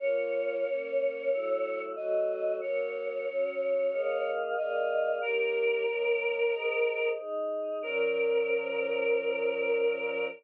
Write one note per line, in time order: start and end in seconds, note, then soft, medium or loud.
0.00 0.64 A#3 medium
0.00 0.64 F4 medium
0.00 0.64 C#5 medium
0.00 1.82 C#5 loud
0.65 1.30 A#3 medium
0.65 1.30 C#4 medium
0.65 1.29 C#5 medium
1.30 1.94 F#3 medium
1.30 1.94 A3 medium
1.30 1.94 E4 medium
1.30 1.94 C#5 medium
1.96 2.61 F#3 medium
1.96 2.61 A3 medium
1.96 2.61 F#4 medium
1.96 2.61 C#5 medium
1.96 2.55 D#5 medium
2.61 3.26 F#3 medium
2.61 3.26 A#3 medium
2.61 4.31 C#5 loud
2.61 3.26 C#5 medium
3.27 3.91 F#3 medium
3.27 3.91 C#4 medium
3.27 3.91 C#5 medium
3.91 4.55 A#3 medium
3.91 4.55 G#4 medium
3.91 4.55 D#5 medium
3.91 4.55 F5 medium
4.57 5.20 A#3 medium
4.57 5.22 G#4 medium
4.57 5.22 D5 medium
4.57 5.16 D#5 medium
4.57 5.22 F5 medium
5.21 5.85 D#3 medium
5.21 5.85 A#3 medium
5.21 5.85 G4 medium
5.21 7.08 A#4 loud
5.21 5.85 C#5 medium
5.87 6.52 D#3 medium
5.87 6.52 A#3 medium
5.87 6.52 A#4 medium
5.87 6.52 C#5 medium
6.53 7.17 G#4 medium
6.53 7.17 C5 medium
6.53 7.17 D#5 medium
7.18 7.82 D#4 medium
7.18 7.82 G#4 medium
7.18 7.82 D#5 medium
7.82 10.25 A#2 loud
7.82 10.25 F3 loud
7.82 10.25 C#4 loud
7.82 10.26 A#4 loud